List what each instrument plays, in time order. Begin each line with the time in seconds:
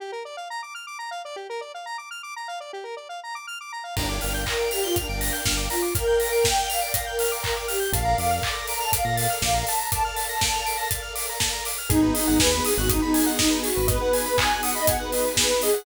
0.00 lead 1 (square) G4
0.12 lead 1 (square) A#4
0.25 lead 1 (square) D5
0.37 lead 1 (square) F5
0.50 lead 1 (square) A#5
0.63 lead 1 (square) D6
0.75 lead 1 (square) F6
0.87 lead 1 (square) D6
0.99 lead 1 (square) A#5
1.11 lead 1 (square) F5
1.25 lead 1 (square) D5
1.36 lead 1 (square) G4
1.50 lead 1 (square) A#4
1.61 lead 1 (square) D5
1.74 lead 1 (square) F5
1.86 lead 1 (square) A#5
1.98 lead 1 (square) D6
2.11 lead 1 (square) F6
2.23 lead 1 (square) D6
2.36 lead 1 (square) A#5
2.48 lead 1 (square) F5
2.60 lead 1 (square) D5
2.73 lead 1 (square) G4
2.84 lead 1 (square) A#4
2.97 lead 1 (square) D5
3.09 lead 1 (square) F5
3.24 lead 1 (square) A#5
3.35 lead 1 (square) D6
3.47 lead 1 (square) F6
3.61 lead 1 (square) D6
3.72 lead 1 (square) A#5
3.84 lead 1 (square) F5
3.96 synth bass 1 G1, ocarina D4, lead 2 (sawtooth) A#4 D5 F5 G5, lead 1 (square) A#5, kick, crash
4.09 lead 1 (square) D6
4.21 synth bass 1 G1, lead 1 (square) F6, open hi-hat
4.34 lead 1 (square) G6
4.46 ocarina A#4, lead 1 (square) A#6, kick, clap
4.59 lead 1 (square) D7
4.71 ocarina G4, lead 1 (square) F7, open hi-hat
4.83 ocarina F4, lead 1 (square) G7
4.96 ocarina D4, lead 1 (square) F7, kick, closed hi-hat
5.09 synth bass 1 G1, ocarina D4, lead 1 (square) D7
5.20 lead 1 (square) A#6, open hi-hat
5.33 lead 1 (square) G6
5.45 synth bass 1 G1, ocarina D4, lead 1 (square) F6, kick, snare
5.57 lead 1 (square) D6
5.70 ocarina F4, lead 1 (square) A#5, open hi-hat
5.82 lead 1 (square) D6
5.95 lead 2 (sawtooth) A#4 D5 F5 G5, ocarina A#4, lead 1 (square) F6, kick, closed hi-hat
6.07 lead 1 (square) G6
6.20 lead 1 (square) A#6, open hi-hat
6.32 lead 1 (square) D7
6.43 ocarina G5, lead 1 (square) F7, kick, snare
6.57 lead 1 (square) G7
6.69 ocarina F5, lead 1 (square) F7, open hi-hat
6.81 ocarina D5, lead 1 (square) D7
6.94 ocarina F5, lead 1 (square) A#6, kick, closed hi-hat
7.06 ocarina A#4, lead 1 (square) G6
7.19 lead 1 (square) F6, open hi-hat
7.32 lead 1 (square) D6
7.43 ocarina A#4, lead 1 (square) A#5, kick, clap
7.57 lead 1 (square) D6
7.68 ocarina G4, lead 1 (square) F6, open hi-hat
7.80 lead 1 (square) G6
7.92 synth bass 1 A#1, lead 2 (sawtooth) A4 A#4 D5 F5, ocarina F5, lead 1 (square) A5, kick, closed hi-hat
8.05 lead 1 (square) A#5
8.18 synth bass 1 F2, lead 1 (square) D6, open hi-hat
8.31 lead 1 (square) F6
8.43 ocarina D6, lead 1 (square) A6, kick, clap
8.55 lead 1 (square) A#6
8.68 ocarina A#5, lead 1 (square) D7, open hi-hat
8.80 ocarina A5, lead 1 (square) F7
8.93 ocarina F5, lead 1 (square) D7, kick, closed hi-hat
9.05 synth bass 1 A#2, ocarina F5, lead 1 (square) A#6
9.17 lead 1 (square) A6, open hi-hat
9.30 lead 1 (square) F6
9.42 synth bass 1 A#1, ocarina F5, lead 1 (square) D6, kick, snare
9.54 lead 1 (square) A#5
9.67 ocarina A5, lead 1 (square) A5, open hi-hat
9.78 lead 1 (square) A#5
9.92 lead 2 (sawtooth) A4 A#4 D5 F5, ocarina A5, lead 1 (square) D6, kick, closed hi-hat
10.04 ocarina A5, lead 1 (square) F6
10.16 lead 1 (square) A6, open hi-hat
10.29 ocarina A5, lead 1 (square) A#6
10.41 lead 1 (square) D7, kick, snare
10.54 lead 1 (square) F7
10.66 lead 1 (square) D7, open hi-hat
10.77 lead 1 (square) A#6
10.91 lead 1 (square) A6, kick, closed hi-hat
11.02 lead 1 (square) F6
11.15 lead 1 (square) D6, open hi-hat
11.29 lead 1 (square) A#5
11.40 lead 1 (square) A5, kick, snare
11.53 lead 1 (square) A#5
11.65 lead 1 (square) D6, open hi-hat
11.78 lead 1 (square) F6
11.89 synth bass 1 G#1, lead 2 (sawtooth) B3 D#4 F#4 G#4, ocarina D#4, lead 1 (square) G#4, kick, closed hi-hat
12.02 lead 1 (square) B4
12.14 lead 1 (square) D#5, open hi-hat
12.27 synth bass 1 G#1, lead 1 (square) F#5
12.39 synth bass 1 D#2, ocarina B4, lead 1 (square) G#5, kick, snare
12.52 lead 1 (square) B5
12.65 ocarina G#4, lead 1 (square) D#6, open hi-hat
12.77 synth bass 1 G#1, ocarina F#4, lead 1 (square) F#6
12.89 ocarina D#4, lead 1 (square) D#6, kick, closed hi-hat
13.02 ocarina D#4, lead 1 (square) B5
13.14 lead 1 (square) G#5, open hi-hat
13.26 lead 1 (square) F#5
13.38 ocarina D#4, lead 1 (square) D#5, kick, snare
13.51 lead 1 (square) B4
13.63 ocarina F#4, lead 1 (square) G#4, open hi-hat
13.76 synth bass 1 G#1, lead 1 (square) B4
13.88 lead 2 (sawtooth) B3 D#4 F#4 G#4, ocarina B4, lead 1 (square) D#5, kick, closed hi-hat
14.01 lead 1 (square) F#5
14.13 lead 1 (square) G#5, open hi-hat
14.26 lead 1 (square) B5
14.37 ocarina G#5, lead 1 (square) D#6, kick, clap
14.50 lead 1 (square) F#6
14.63 ocarina F#5, lead 1 (square) D#6, open hi-hat
14.75 ocarina D#5, lead 1 (square) B5
14.87 ocarina F#5, lead 1 (square) G#5, kick, closed hi-hat
14.99 ocarina B4, lead 1 (square) F#5
15.12 lead 1 (square) D#5, open hi-hat
15.25 lead 1 (square) B4
15.36 lead 1 (square) G#4, ocarina B4, kick, snare
15.50 lead 1 (square) B4
15.62 ocarina G#4, lead 1 (square) D#5, open hi-hat
15.73 lead 1 (square) F#5